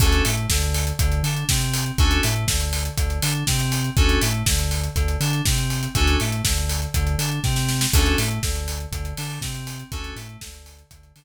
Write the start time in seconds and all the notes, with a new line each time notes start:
0.00 D2 C#4 D4 F#4 A4, kick, crash
0.12 closed hi-hat
0.24 A2 A3, open hi-hat
0.37 closed hi-hat
0.50 D2 D3, kick, snare
0.62 closed hi-hat
0.74 open hi-hat
0.87 closed hi-hat
0.99 D2 D3, kick, closed hi-hat
1.12 closed hi-hat
1.23 D3 D4, open hi-hat
1.36 closed hi-hat
1.49 C3 C4, kick, snare
1.61 closed hi-hat
1.74 open hi-hat
1.86 closed hi-hat
1.98 D2 C#4 D4 F#4 A4, kick, closed hi-hat
2.11 closed hi-hat
2.23 A2 A3, open hi-hat
2.36 closed hi-hat
2.47 D2 D3, kick, snare
2.60 closed hi-hat
2.73 open hi-hat
2.85 closed hi-hat
2.98 D2 D3, kick, closed hi-hat
3.10 closed hi-hat
3.22 D3 D4, open hi-hat
3.35 closed hi-hat
3.47 C3 C4, kick, snare
3.60 closed hi-hat
3.72 open hi-hat
3.84 closed hi-hat
3.96 D2 C#4 D4 F#4 A4, kick, closed hi-hat
4.09 closed hi-hat
4.21 A2 A3, open hi-hat
4.34 closed hi-hat
4.46 D2 D3, kick, snare
4.59 closed hi-hat
4.71 open hi-hat
4.83 closed hi-hat
4.96 D2 D3, kick, closed hi-hat
5.08 closed hi-hat
5.20 D3 D4, open hi-hat
5.33 closed hi-hat
5.45 C3 C4, kick, snare
5.58 closed hi-hat
5.70 open hi-hat
5.83 closed hi-hat
5.95 D2 C#4 D4 F#4 A4, kick, closed hi-hat
6.07 closed hi-hat
6.20 A2 A3, open hi-hat
6.32 closed hi-hat
6.44 D2 D3, kick, snare
6.57 closed hi-hat
6.69 open hi-hat
6.82 closed hi-hat
6.94 D2 D3, kick, closed hi-hat
7.07 closed hi-hat
7.18 D3 D4, open hi-hat
7.31 closed hi-hat
7.43 C3 C4, kick, snare
7.56 snare
7.69 snare
7.81 snare
7.93 D2 C#4 D4 F#4 A4, kick, crash
8.06 closed hi-hat
8.18 A2 A3, open hi-hat
8.31 closed hi-hat
8.43 D2 D3, kick, snare
8.55 closed hi-hat
8.68 open hi-hat
8.80 closed hi-hat
8.92 D2 D3, kick, closed hi-hat
9.05 closed hi-hat
9.17 D3 D4, open hi-hat
9.30 open hi-hat
9.41 C3 C4, kick, snare
9.55 closed hi-hat
9.67 open hi-hat
9.79 closed hi-hat
9.92 D2 C#4 D4 F#4 A4, kick, closed hi-hat
10.04 closed hi-hat
10.16 A2 A3, open hi-hat
10.29 closed hi-hat
10.41 D2 D3, kick, snare
10.54 closed hi-hat
10.66 open hi-hat
10.79 closed hi-hat
10.91 D2 D3, kick, closed hi-hat
11.03 closed hi-hat
11.15 D3 D4, open hi-hat